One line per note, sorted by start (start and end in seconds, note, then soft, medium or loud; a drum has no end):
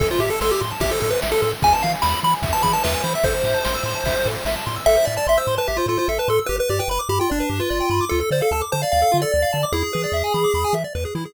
0.00 0.12 A1 loud
0.00 0.07 A4 medium
0.00 0.09 A4 medium
0.00 kick loud
0.00 ride loud
0.10 0.20 F4 medium
0.10 0.19 C5 medium
0.19 0.30 A2 medium
0.19 0.30 G4 medium
0.19 0.29 E5 medium
0.19 ride medium
0.30 0.40 A4 medium
0.30 0.40 A5 medium
0.41 0.52 A1 medium
0.41 0.51 A4 medium
0.41 0.50 C6 medium
0.41 snare loud
0.51 0.61 G4 medium
0.51 0.60 E6 medium
0.61 0.73 A2 medium
0.61 0.70 C6 medium
0.61 ride medium
0.71 0.80 A5 medium
0.80 0.92 A1 medium
0.80 0.91 G4 medium
0.80 0.91 E5 medium
0.80 kick medium
0.80 ride loud
0.91 1.00 A4 medium
0.91 1.00 C5 medium
1.00 1.13 A2 medium
1.00 1.10 A4 medium
1.00 1.11 A4 medium
1.00 ride medium
1.10 1.20 B4 medium
1.10 1.21 C5 medium
1.22 1.34 A1 medium
1.22 1.31 E5 medium
1.22 snare loud
1.32 1.41 A4 medium
1.32 1.41 A5 medium
1.42 1.53 A2 medium
1.42 1.51 A4 medium
1.42 1.51 C6 medium
1.42 ride medium
1.52 1.61 E6 medium
1.62 1.73 E2 medium
1.62 1.71 G#4 medium
1.62 1.73 G#5 medium
1.62 kick loud
1.62 ride loud
1.72 1.82 B4 medium
1.72 1.83 A5 medium
1.82 1.95 E3 medium
1.82 1.91 E5 medium
1.82 1.92 F5 medium
1.82 ride medium
1.93 2.02 G#5 medium
2.02 2.15 E2 loud
2.02 2.20 B5 medium
2.02 2.12 B5 medium
2.02 snare loud
2.13 2.22 E6 medium
2.23 2.34 E3 medium
2.23 2.32 B5 medium
2.23 2.34 B5 medium
2.23 ride medium
2.33 2.42 G#5 medium
2.42 2.54 E2 medium
2.42 2.52 E5 medium
2.42 kick loud
2.42 ride loud
2.53 2.63 B4 medium
2.53 2.62 A5 medium
2.63 2.76 E3 medium
2.63 2.72 G#4 medium
2.63 2.72 B5 medium
2.63 kick medium
2.63 ride medium
2.73 2.82 B4 medium
2.73 2.83 A5 medium
2.84 2.96 E2 medium
2.84 3.03 B4 medium
2.84 2.93 E5 medium
2.84 snare loud
2.94 3.03 G#5 medium
3.04 3.15 E3 medium
3.04 3.13 C5 medium
3.04 3.13 B5 medium
3.04 ride medium
3.14 3.25 E5 medium
3.14 3.23 E6 medium
3.23 3.35 A1 loud
3.23 3.34 A4 medium
3.23 4.28 C5 medium
3.23 kick loud
3.23 ride medium
3.34 3.43 C5 medium
3.44 3.55 A2 medium
3.44 3.54 E5 medium
3.44 ride medium
3.54 3.63 A5 medium
3.65 3.77 A1 medium
3.65 3.74 C6 medium
3.65 snare loud
3.75 3.84 E6 medium
3.83 3.95 A2 loud
3.83 3.94 C6 medium
3.83 ride medium
3.95 4.04 A5 medium
4.04 4.15 A1 medium
4.04 4.15 E5 medium
4.04 kick medium
4.04 ride loud
4.16 4.25 C5 medium
4.26 4.37 A2 medium
4.26 4.35 A4 medium
4.26 ride medium
4.35 4.44 C5 medium
4.45 4.56 A1 medium
4.45 4.55 E5 medium
4.45 snare loud
4.56 4.65 A5 medium
4.66 4.78 A2 medium
4.66 4.75 C6 medium
4.66 ride medium
4.76 4.85 E6 medium
4.86 4.97 A1 loud
4.86 4.96 A4 loud
4.86 5.05 E5 medium
4.97 5.06 C5 medium
5.05 5.18 A2 medium
5.05 5.15 D5 medium
5.05 5.16 E5 medium
5.17 5.27 D5 medium
5.17 5.26 A5 medium
5.27 5.38 A1 loud
5.27 5.38 E5 medium
5.27 5.36 C6 medium
5.37 5.55 C5 medium
5.37 5.47 E6 medium
5.47 5.58 A2 medium
5.47 5.57 C6 medium
5.58 5.68 B4 medium
5.58 5.67 A5 medium
5.68 5.80 A1 medium
5.68 5.77 G4 medium
5.68 5.77 E5 medium
5.77 5.86 F4 medium
5.77 5.87 C5 medium
5.86 5.97 A2 medium
5.86 5.98 F4 medium
5.86 5.97 A4 medium
5.98 6.08 F4 medium
5.98 6.07 C5 medium
6.08 6.19 A1 medium
6.08 6.18 A4 medium
6.08 6.18 E5 medium
6.18 6.29 B4 medium
6.18 6.28 A5 medium
6.28 6.39 A2 medium
6.28 6.39 A4 medium
6.28 6.37 C6 medium
6.39 6.48 E6 medium
6.46 6.60 G1 loud
6.46 6.58 G4 loud
6.46 6.56 B4 medium
6.59 6.68 B4 medium
6.59 6.70 B4 medium
6.69 6.81 G2 medium
6.69 6.80 G4 medium
6.69 6.78 D5 medium
6.79 6.89 B4 medium
6.79 6.88 G5 medium
6.88 6.99 G1 medium
6.88 7.01 B4 medium
6.88 6.98 B5 medium
6.99 7.08 D6 medium
7.09 7.20 G2 medium
7.09 7.19 G4 medium
7.09 7.19 B5 medium
7.20 7.30 F4 medium
7.20 7.29 G5 medium
7.30 7.42 G1 medium
7.30 7.61 D4 medium
7.30 7.39 D5 medium
7.40 7.49 B4 medium
7.49 7.61 G2 medium
7.49 7.59 G4 medium
7.60 8.05 F4 medium
7.60 7.69 B4 medium
7.70 7.82 G1 medium
7.70 7.79 D5 medium
7.80 7.89 G5 medium
7.90 8.01 G2 medium
7.90 8.00 B5 medium
8.01 8.10 D6 medium
8.09 8.23 D2 loud
8.09 8.20 F4 loud
8.09 8.19 A4 medium
8.20 8.29 A4 medium
8.20 8.30 A4 medium
8.31 8.42 D3 medium
8.31 8.42 C5 medium
8.31 8.40 D5 medium
8.41 8.52 A4 medium
8.41 8.50 F5 medium
8.51 8.62 D2 medium
8.51 8.62 A4 medium
8.51 8.61 A5 medium
8.61 8.71 D6 medium
8.72 8.84 D3 medium
8.72 8.82 C5 medium
8.72 8.81 A5 medium
8.82 8.92 D5 medium
8.82 8.91 F5 medium
8.92 9.04 D2 medium
8.92 9.01 D5 loud
8.92 9.18 F5 medium
9.02 9.11 A4 medium
9.12 9.25 D3 loud
9.12 9.21 F4 medium
9.22 9.32 A4 medium
9.22 9.65 D5 medium
9.32 9.45 D2 loud
9.32 9.41 D5 medium
9.42 9.52 F5 medium
9.53 9.65 D3 medium
9.53 9.62 A5 medium
9.63 9.72 D6 medium
9.72 9.84 E2 loud
9.72 9.83 E4 loud
9.72 10.75 G#4 medium
9.83 9.92 G#4 medium
9.93 10.06 E3 medium
9.93 10.02 B4 medium
10.04 10.13 D5 medium
10.12 10.23 E2 medium
10.12 10.23 E5 medium
10.24 10.33 G#5 medium
10.34 10.45 E3 medium
10.34 10.43 B5 medium
10.44 10.53 D6 medium
10.54 10.65 E2 medium
10.54 10.64 B5 medium
10.64 10.73 G#5 medium
10.73 10.84 E3 medium
10.73 10.83 E5 medium
10.84 10.93 D5 medium
10.95 11.06 E2 medium
10.95 11.04 B4 medium
11.05 11.14 G#4 medium
11.15 11.26 E3 loud
11.15 11.24 E4 medium
11.25 11.34 G#4 medium